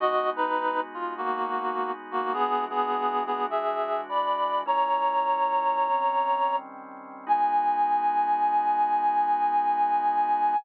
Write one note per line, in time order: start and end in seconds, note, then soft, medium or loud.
0.00 2.31 G#3 medium
0.00 2.31 B3 medium
0.00 2.31 D#4 medium
0.00 0.29 F#4 medium
0.00 2.31 F#4 medium
0.00 0.29 D#5 loud
0.36 0.80 D#4 medium
0.36 0.80 B4 medium
0.94 1.13 F4 medium
1.17 1.91 A#3 medium
1.17 1.91 F#4 medium
2.11 2.33 A#3 medium
2.11 2.33 F#4 medium
2.33 4.64 E3 medium
2.33 4.64 G#3 medium
2.33 2.64 B3 medium
2.33 4.64 D4 medium
2.33 4.64 F#4 medium
2.33 2.64 G#4 medium
2.70 3.23 B3 medium
2.70 3.23 G#4 medium
3.26 3.46 B3 medium
3.26 3.46 G#4 medium
3.50 4.00 G#4 medium
3.50 4.00 E5 medium
4.09 4.61 D5 medium
4.09 4.61 B5 medium
4.66 5.88 A#2 medium
4.66 5.88 G#3 medium
4.66 5.88 C#4 medium
4.66 5.88 E4 medium
4.66 6.56 C#5 medium
4.66 6.56 A#5 medium
5.89 7.25 D#3 medium
5.89 7.25 G3 medium
5.89 7.25 C4 medium
5.89 7.25 C#4 medium
7.27 10.55 G#3 loud
7.27 10.55 B3 loud
7.27 10.55 D#4 loud
7.27 10.55 F#4 medium
7.27 10.56 G#5 loud